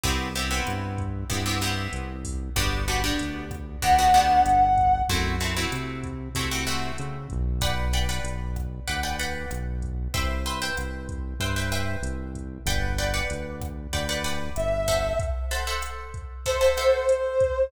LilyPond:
<<
  \new Staff \with { instrumentName = "Brass Section" } { \time 4/4 \key g \major \tempo 4 = 95 r1 | r2 fis''2 | r1 | r1 |
r1 | r2. e''4 | r2 c''2 | }
  \new Staff \with { instrumentName = "Acoustic Guitar (steel)" } { \time 4/4 \key g \major <b c' e' g'>8 <b c' e' g'>16 <b c' e' g'>4~ <b c' e' g'>16 <b c' e' g'>16 <b c' e' g'>16 <b c' e' g'>4. | <b d' fis' g'>8 <b d' fis' g'>16 <b d' fis' g'>4~ <b d' fis' g'>16 <b d' fis' g'>16 <b d' fis' g'>16 <b d' fis' g'>4. | <a c' e' fis'>8 <a c' e' fis'>16 <a c' e' fis'>4~ <a c' e' fis'>16 <a c' e' fis'>16 <a c' e' fis'>16 <a c' e' fis'>4. | <b' d'' fis'' g''>8 <b' d'' fis'' g''>16 <b' d'' fis'' g''>4~ <b' d'' fis'' g''>16 <b' d'' fis'' g''>16 <b' d'' fis'' g''>16 <b' d'' fis'' g''>4. |
<b' c'' e'' g''>8 <b' c'' e'' g''>16 <b' c'' e'' g''>4~ <b' c'' e'' g''>16 <b' c'' e'' g''>16 <b' c'' e'' g''>16 <b' c'' e'' g''>4. | <b' d'' fis'' g''>8 <b' d'' fis'' g''>16 <b' d'' fis'' g''>4~ <b' d'' fis'' g''>16 <b' d'' fis'' g''>16 <b' d'' fis'' g''>16 <b' d'' fis'' g''>4 <a' c'' e'' fis''>8~ | <a' c'' e'' fis''>8 <a' c'' e'' fis''>16 <a' c'' e'' fis''>4~ <a' c'' e'' fis''>16 <a' c'' e'' fis''>16 <a' c'' e'' fis''>16 <a' c'' e'' fis''>4. | }
  \new Staff \with { instrumentName = "Synth Bass 1" } { \clef bass \time 4/4 \key g \major c,4 g,4 g,4 c,4 | g,,4 d,4 d,4 g,,4 | fis,4 c4 c4 cis8 b,,8~ | b,,4 b,,4 d,4 b,,4 |
c,4 c,4 g,4 c,4 | g,,4 d,4 d,4 g,,4 | r1 | }
  \new DrumStaff \with { instrumentName = "Drums" } \drummode { \time 4/4 <hh bd>8 hh8 <hh ss>8 <hh bd>8 <hh bd>8 <hh ss>8 hh8 <hho bd>8 | <hh bd ss>8 hh8 hh8 <hh bd ss>8 <hh bd>8 hh8 <hh ss>8 <hh bd>8 | bd8 hh8 <hh ss>8 <hh bd>8 <hh bd>8 <hh ss>8 hh8 <hh bd>8 | <hh bd ss>8 hh8 hh8 <hh bd ss>8 <hh bd>8 hh8 <hh ss>8 <hh bd>8 |
<hh bd>8 hh8 <hh ss>8 <hh bd>8 <hh bd>8 <hh ss>8 hh8 <hh bd>8 | <hh bd ss>8 hh8 hh8 <hh bd ss>8 <hh bd>8 hh8 <hh ss>8 <hho bd>8 | <hh bd>8 hh8 <hh ss>8 <hh bd>8 <hh bd>8 <hh ss>8 hh8 <hh bd>8 | }
>>